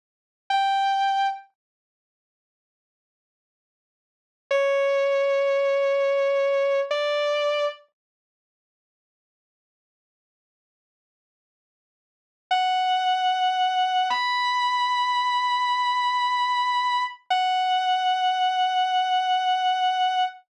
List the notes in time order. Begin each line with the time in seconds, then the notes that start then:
0.50 G5
4.51 C#5
6.91 D5
12.51 F#5
14.10 B5
17.30 F#5